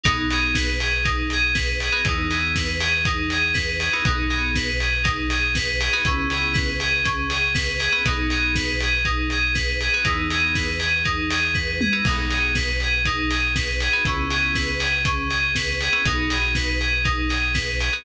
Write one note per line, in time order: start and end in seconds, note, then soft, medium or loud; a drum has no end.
0.04 1.90 B1 medium
0.04 0.25 B3 loud
0.04 0.27 D#4 medium
0.04 0.25 D#4 loud
0.04 0.25 F#4 medium
0.04 0.25 G#4 loud
0.04 kick loud
0.04 closed hi-hat loud
0.31 0.71 B3 medium
0.31 0.71 D#4 medium
0.31 0.71 F#4 medium
0.31 0.71 G#4 medium
0.31 0.55 G#4 medium
0.31 open hi-hat medium
0.55 0.79 B4 medium
0.55 kick medium
0.55 snare loud
0.80 1.03 G#4 medium
0.80 open hi-hat medium
1.04 1.27 D#4 medium
1.04 kick medium
1.04 closed hi-hat loud
1.30 1.55 G#4 medium
1.30 open hi-hat medium
1.54 1.77 B4 medium
1.54 kick medium
1.54 snare loud
1.80 2.06 G#4 medium
1.80 open hi-hat medium
1.92 2.02 B3 medium
1.92 2.02 D#4 medium
1.92 2.02 F#4 medium
1.92 2.02 G#4 medium
2.05 3.89 E2 medium
2.05 2.25 B3 loud
2.05 2.25 D#4 loud
2.05 2.30 D#4 medium
2.05 2.25 E4 medium
2.05 2.25 G#4 medium
2.05 kick loud
2.05 closed hi-hat loud
2.30 2.70 B3 medium
2.30 2.70 D#4 medium
2.30 2.70 E4 medium
2.30 2.53 G#4 medium
2.30 2.70 G#4 medium
2.30 open hi-hat medium
2.56 2.79 B4 medium
2.56 kick medium
2.56 snare loud
2.80 3.03 G#4 medium
2.80 open hi-hat medium
3.05 3.29 D#4 medium
3.05 kick loud
3.05 closed hi-hat loud
3.30 3.54 G#4 medium
3.30 open hi-hat medium
3.54 3.77 B4 medium
3.54 kick medium
3.54 snare loud
3.80 4.03 G#4 medium
3.80 open hi-hat medium
3.93 4.03 B3 medium
3.93 4.03 D#4 medium
3.93 4.03 E4 medium
3.93 4.03 G#4 medium
4.05 5.89 B1 medium
4.05 4.25 B3 loud
4.05 4.25 D#4 medium
4.05 4.29 D#4 medium
4.05 4.25 F#4 medium
4.05 4.25 G#4 medium
4.05 kick loud
4.05 closed hi-hat loud
4.30 4.70 B3 medium
4.30 4.70 D#4 medium
4.30 4.70 F#4 medium
4.30 4.53 G#4 medium
4.30 4.70 G#4 medium
4.30 open hi-hat medium
4.55 4.79 B4 medium
4.55 kick medium
4.55 snare loud
4.80 5.03 G#4 medium
4.80 open hi-hat medium
5.03 5.26 D#4 medium
5.03 kick loud
5.03 closed hi-hat loud
5.30 5.53 G#4 medium
5.30 open hi-hat medium
5.55 5.79 B4 medium
5.55 kick medium
5.55 snare loud
5.80 6.03 G#4 medium
5.80 open hi-hat medium
5.93 6.03 B3 medium
5.93 6.03 D#4 medium
5.93 6.03 F#4 loud
5.93 6.03 G#4 medium
6.05 7.89 C#2 medium
6.05 6.25 B3 loud
6.05 6.28 C#4 medium
6.05 6.25 C#4 loud
6.05 6.25 E4 medium
6.05 6.25 G#4 loud
6.05 kick loud
6.05 closed hi-hat loud
6.30 6.70 B3 medium
6.30 6.70 C#4 medium
6.30 6.70 E4 medium
6.30 6.70 G#4 medium
6.30 6.56 G#4 medium
6.30 open hi-hat medium
6.53 6.76 B4 medium
6.53 kick loud
6.53 snare loud
6.80 7.03 G#4 medium
6.80 open hi-hat medium
7.04 7.27 C#4 medium
7.04 kick medium
7.04 closed hi-hat loud
7.30 7.53 G#4 medium
7.30 open hi-hat medium
7.54 7.77 B4 medium
7.54 kick medium
7.54 snare loud
7.78 8.01 G#4 medium
7.78 open hi-hat medium
7.92 8.02 B3 medium
7.92 8.02 C#4 medium
7.92 8.02 E4 medium
7.92 8.02 G#4 medium
8.05 9.89 B1 medium
8.05 8.25 B3 loud
8.05 8.25 D#4 loud
8.05 8.30 D#4 medium
8.05 8.25 F#4 loud
8.05 8.25 G#4 medium
8.05 kick loud
8.05 closed hi-hat loud
8.30 8.71 B3 medium
8.30 8.71 D#4 medium
8.30 8.71 F#4 medium
8.30 8.53 G#4 medium
8.30 8.71 G#4 medium
8.30 open hi-hat medium
8.55 8.78 B4 medium
8.55 kick medium
8.55 snare loud
8.81 9.06 G#4 medium
8.81 open hi-hat medium
9.05 9.28 D#4 medium
9.05 kick medium
9.05 closed hi-hat medium
9.30 9.54 G#4 medium
9.30 open hi-hat medium
9.54 9.78 B4 medium
9.54 kick medium
9.54 snare loud
9.80 10.03 G#4 medium
9.80 open hi-hat medium
9.94 10.04 B3 medium
9.94 10.04 D#4 medium
9.94 10.04 F#4 medium
9.94 10.04 G#4 medium
10.04 11.89 E2 medium
10.04 10.26 B3 medium
10.04 10.27 D#4 medium
10.04 10.26 D#4 loud
10.04 10.26 E4 loud
10.04 10.26 G#4 loud
10.04 kick loud
10.04 closed hi-hat loud
10.30 10.70 B3 medium
10.30 10.70 D#4 medium
10.30 10.70 E4 medium
10.30 10.53 G#4 medium
10.30 10.70 G#4 medium
10.30 open hi-hat medium
10.55 10.78 B4 medium
10.55 kick medium
10.55 snare loud
10.79 11.02 G#4 medium
10.79 open hi-hat medium
11.04 11.27 D#4 medium
11.04 kick medium
11.04 closed hi-hat medium
11.31 11.54 G#4 medium
11.31 open hi-hat loud
11.54 11.77 B4 medium
11.54 kick medium
11.54 snare medium
11.81 12.04 G#4 medium
11.81 mid tom loud
11.93 12.03 B3 medium
11.93 12.03 D#4 medium
11.93 12.03 E4 medium
11.93 12.03 G#4 medium
12.05 13.89 B1 medium
12.05 12.26 B3 medium
12.05 12.26 D#4 medium
12.05 12.29 D#4 medium
12.05 12.26 F#4 loud
12.05 12.26 G#4 loud
12.05 kick loud
12.05 crash loud
12.30 12.70 B3 medium
12.30 12.70 D#4 medium
12.30 12.70 F#4 medium
12.30 12.70 G#4 medium
12.30 12.54 G#4 medium
12.30 open hi-hat medium
12.55 12.79 B4 medium
12.55 kick medium
12.55 snare loud
12.80 13.05 G#4 medium
12.80 open hi-hat medium
13.05 13.29 D#4 medium
13.05 kick medium
13.05 closed hi-hat loud
13.30 13.53 G#4 medium
13.30 open hi-hat medium
13.55 13.78 B4 medium
13.55 kick medium
13.55 snare loud
13.80 14.04 G#4 medium
13.80 open hi-hat medium
13.93 14.03 B3 medium
13.93 14.03 D#4 medium
13.93 14.03 F#4 medium
13.93 14.03 G#4 medium
14.05 15.89 C#2 medium
14.05 14.25 B3 loud
14.05 14.25 C#4 loud
14.05 14.29 C#4 medium
14.05 14.25 E4 loud
14.05 14.25 G#4 loud
14.05 kick loud
14.05 closed hi-hat loud
14.30 14.71 B3 medium
14.30 14.71 C#4 medium
14.30 14.71 E4 medium
14.30 14.53 G#4 medium
14.30 14.71 G#4 medium
14.30 open hi-hat medium
14.55 14.78 B4 medium
14.55 kick medium
14.55 snare loud
14.79 15.02 G#4 medium
14.79 open hi-hat medium
15.04 15.27 C#4 medium
15.04 kick medium
15.04 closed hi-hat loud
15.30 15.53 G#4 medium
15.30 open hi-hat medium
15.55 15.79 B4 medium
15.55 kick medium
15.55 snare loud
15.81 16.05 G#4 medium
15.81 open hi-hat medium
15.92 16.02 B3 medium
15.92 16.02 C#4 medium
15.92 16.02 E4 medium
15.92 16.02 G#4 medium
16.05 17.90 B1 medium
16.05 16.25 B3 loud
16.05 16.25 D#4 loud
16.05 16.29 D#4 medium
16.05 16.25 F#4 loud
16.05 16.25 G#4 medium
16.05 kick loud
16.05 closed hi-hat loud
16.30 16.70 B3 medium
16.30 16.70 D#4 medium
16.30 16.70 F#4 medium
16.30 16.70 G#4 medium
16.30 16.53 G#4 medium
16.30 open hi-hat medium
16.55 16.79 B4 medium
16.55 kick medium
16.55 snare loud
16.80 17.03 G#4 medium
16.80 open hi-hat medium
17.04 17.27 D#4 medium
17.04 kick loud
17.04 closed hi-hat loud
17.29 17.52 G#4 medium
17.29 open hi-hat medium
17.54 17.77 B4 medium
17.54 kick medium
17.54 snare loud
17.80 18.03 G#4 medium
17.80 open hi-hat medium
17.93 18.03 B3 medium
17.93 18.03 D#4 medium
17.93 18.03 F#4 medium
17.93 18.03 G#4 medium